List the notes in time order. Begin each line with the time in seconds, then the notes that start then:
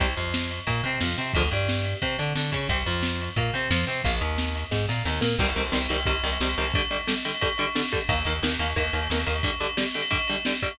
0.00 C2 C3 G3, kick, ride
0.17 F2 F3, ride
0.34 snare
0.51 ride
0.67 A#2 A#3, kick, ride
0.84 C3 C4, ride
1.01 F2 F3, snare
1.17 C3 C4, ride
1.34 D2 D3 F3 G#3, kick, ride
1.51 G2 G3, ride
1.69 snare
1.84 ride
2.02 C3 C4, kick, ride
2.19 D3 D4, ride
2.35 D3 D4, snare
2.52 C#3 C#4, kick, ride
2.69 C2 C4 G4, kick, ride
2.86 F2 F3, ride
3.03 snare
3.21 ride
3.36 A#2 A#3, kick, ride
3.54 C3 C4, ride
3.70 F2 F3, snare
3.87 C3 C4, ride
4.04 A#1 A#3 F4, kick, ride
4.21 D#2 D#3, ride
4.38 snare
4.56 ride
4.71 G#2 G#3, kick, snare
4.89 A#2 A#3, snare
5.05 D#2 D#3, snare
5.21 A#2 A#3, snare
5.39 C2 C3 D#3 G3, kick, crash
5.48 ride
5.56 C2 C3 D#3 G3, ride
5.65 ride
5.72 C2 C3 D#3 G3, snare
5.82 ride
5.89 C2 C3 D#3 G3, ride
5.99 ride
6.05 C2 C3 D#3 G3, kick, ride
6.15 ride
6.24 C2 C3 D#3 G3, ride
6.33 ride
6.40 C2 C3 D#3 G3, snare
6.49 ride
6.57 C2 C3 D#3 G3, ride
6.65 ride
6.74 D3 G3, kick, ride
6.83 ride
6.91 D3 G3, ride
6.99 ride
7.07 D3 G3, snare
7.17 ride
7.25 D3 G3, ride
7.34 ride
7.41 D3 G3, kick, ride
7.50 ride
7.58 D3 G3, ride
7.67 ride
7.75 D3 G3, snare
7.84 ride
7.92 D3 G3, kick, ride
8.01 ride
8.09 D#2 D#3 A#3, kick, ride
8.18 ride
8.25 D#2 D#3 A#3, ride
8.35 ride
8.43 D#2 D#3 A#3, snare
8.52 ride
8.59 D#2 D#3 A#3, ride
8.68 ride
8.76 D#2 D#3 A#3, kick, ride
8.84 ride
8.93 D#2 D#3 A#3, ride
9.02 ride
9.10 D#2 D#3 A#3, snare
9.19 ride
9.26 D#2 D#3 A#3, ride
9.36 ride
9.43 D3 G3, kick, ride
9.53 ride
9.60 D3 G3, ride
9.69 ride
9.77 D3 G3, snare
9.86 ride
9.94 D3 G3, ride
10.02 ride
10.11 D3 G3, kick, ride
10.19 ride
10.28 D3 G3, ride
10.35 ride
10.45 D3 G3, snare
10.54 ride
10.62 D3 G3, kick, ride
10.71 ride